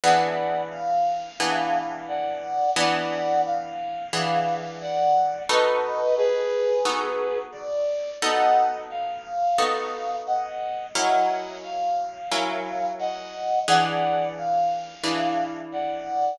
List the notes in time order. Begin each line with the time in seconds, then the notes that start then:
0.04 E3 B3 D4 G#4 D5 F#5
0.71 F5
1.40 E3 B3 D4 G#4
2.08 D5 F#5
2.76 E3 B3 D4 G#4 D5 F#5
3.46 F5
4.13 E3 B3 D4 G#4
4.81 D5 F#5
5.49 B3 D#4 F#4 A4 B4 D#5
6.17 G#4 B4
6.85 B3 D#4 F#4 A4
7.52 D5
8.22 B3 D#4 F#4 A4 D#5 F#5
8.90 F5
9.58 B3 D#4 F#4 A4
10.27 D#5 F#5
10.94 F#3 C#4 E4 A#4 D#5 F#5
11.63 F5
12.31 F#3 C#4 E4 A#4
12.99 D#5 F#5
13.68 E3 D4 G#4 B4 D5 F#5
14.37 F5
15.03 E3 D4 G#4 B4
15.72 D5 F#5